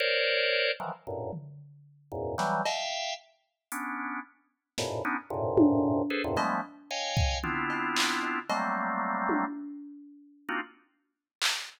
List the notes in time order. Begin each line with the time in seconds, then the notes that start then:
0.00 A#4 C5 C#5 D5
0.80 D#3 E3 F3 F#3
1.07 F#2 G2 A2 A#2
1.33 floor tom
2.12 E2 F#2 G#2 A#2
2.38 E3 F#3 G3, snare
2.65 E5 F5 G5, cowbell
3.72 B3 C#4 D4, closed hi-hat
4.78 F#2 G#2 A2 A#2 B2, snare
5.05 B3 C#4 D4 D#4
5.30 F#2 G#2 A2 A#2 C3
5.58 high tom
6.10 G#4 A4 B4 C5
6.24 E2 F#2 G2 A2 A#2 C3
6.37 F3 G3 G#3 A3 B3, cowbell
6.91 C#5 D#5 F5 G5 G#5
7.17 kick
7.43 B3 C4 D4 E4 F4, floor tom
7.70 cowbell
7.96 clap
8.23 cowbell
8.49 F#3 G3 A3 A#3 C4, cowbell
9.29 high tom
10.49 A#3 C4 D4 D#4 F4 F#4
11.42 clap